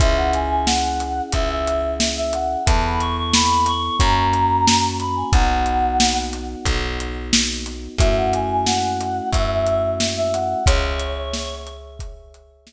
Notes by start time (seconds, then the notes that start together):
0.00 C#2 C#4 E4 G#4 E5, kick, closed hi-hat
0.17 F#5
0.33 G#5, closed hi-hat
0.50 G#5
0.66 F#5, snare
1.00 closed hi-hat
1.32 C#2 E5, kick, closed hi-hat
1.49 E5
1.67 closed hi-hat
2.00 snare
2.17 E5
2.33 F#5, closed hi-hat
2.66 E2 B3 E4 A4 A5, kick, closed hi-hat
2.84 B5
3.00 C#6, closed hi-hat
3.16 C#6
3.33 B5, snare
3.66 C#6, closed hi-hat
3.99 F#2 A#3 C#4 F#4 A#5, kick, closed hi-hat
4.33 closed hi-hat
4.68 snare
5.00 B5, closed hi-hat
5.16 G#5
5.33 B1 B3 D#4 F#4 F#5, kick, closed hi-hat
5.66 closed hi-hat
6.00 snare
6.33 closed hi-hat
6.65 B1, kick, closed hi-hat
7.00 closed hi-hat
7.33 snare
7.66 closed hi-hat
7.98 F#2 A3 C#4 E4 F#4 E5, kick, closed hi-hat
8.17 F#5
8.33 G#5, closed hi-hat
8.50 G#5
8.66 F#5, snare
9.01 closed hi-hat
9.33 F#2 E5, kick, closed hi-hat
9.50 E5
9.67 closed hi-hat
10.00 snare
10.17 E5
10.33 F#5, closed hi-hat
10.66 C#2 G#4 C#5 E5, kick, closed hi-hat
11.00 closed hi-hat
11.33 snare
11.67 closed hi-hat
11.99 kick, closed hi-hat
12.34 closed hi-hat
12.67 snare